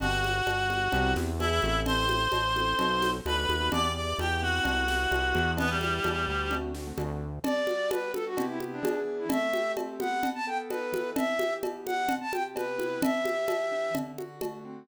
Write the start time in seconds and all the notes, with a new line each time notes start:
0.00 G1 B3 D4 F#4 G4 F#5, cowbell, low conga
0.24 high conga
0.47 G1, cowbell, high conga
0.70 B3 D4 F#4 G4, high conga
0.92 C2 B3 C4 E4 G4, cowbell, low conga
1.16 E2, snare, high conga
1.40 B3 D4 E4 G#4 E5, cowbell, high conga
1.62 A1 C4 E4 G4 A4, high conga
1.86 C5 C6, cowbell, low conga
2.09 high conga
2.32 A1, cowbell, high conga
2.56 C4 E4 G4 A4, high conga
2.79 B1 B3 D#4 F#4 A4, cowbell, low conga
3.02 snare, high conga
3.26 D2 B3 D#4 F#4 A4 B4 B5, cowbell, high conga
3.49 D#2, high conga
3.61 B3 D#4 F#4 A4
3.72 E2 B3 D4 E4 G4 D5 D6, cowbell, low conga
3.84 B3 D4 E4 G4
3.96 D5 D6
4.19 E2 G4 G5, cowbell, high conga
4.42 B3 C4 E4 F#4 G4 F#5
4.64 C2, cowbell, low conga
4.87 B3 C4 E4 G4, snare, high conga
4.99 B3 C4 E4 G4
5.11 C2, cowbell, high conga
5.35 E2, high conga
5.57 B3 D4 E4 G4 B4, cowbell, low conga
5.70 G3 B3 D4 E4 G4
5.81 high conga
6.04 E2, cowbell, high conga
6.28 D2
6.51 A3 C4 D4 F#4, cowbell, low conga
6.75 A3 C4 D4 F#4, snare
6.87 A3 C4 D4 F#4
6.98 D2, cowbell, high conga
7.44 G3 D5, cowbell, low conga
7.67 F#4, high conga
7.91 B3 B4, cowbell, high conga
8.14 D4 A4, high conga
8.26 F#4
8.37 C3 B3 E4 G4, cowbell, low conga
8.48 E4
8.60 high conga
8.72 D4
8.83 E3 B3 D4 G#4, cowbell, high conga
9.19 E4
9.29 A3 E5, cowbell, low conga
9.53 G4, high conga
9.77 C4, cowbell, high conga
10.00 B3 F#5, high conga
10.23 cowbell, low conga
10.35 A5
10.47 A4 G5
10.70 D#4 B4, cowbell, high conga
10.92 E3, high conga
11.16 E5, cowbell, low conga
11.39 G4, high conga
11.63 B3, cowbell, high conga
11.86 D4 F#5, high conga
12.08 C3, cowbell, low conga
12.21 A5
12.32 G4 G5, high conga
12.55 B3 B4, cowbell, high conga
12.78 E4, high conga
13.02 E3 E5, cowbell, low conga
13.25 G4, high conga
13.48 B3, cowbell, high conga
13.72 D4
13.94 D3, cowbell, low conga
14.18 F#4, high conga
14.41 A3, cowbell, high conga
14.65 C4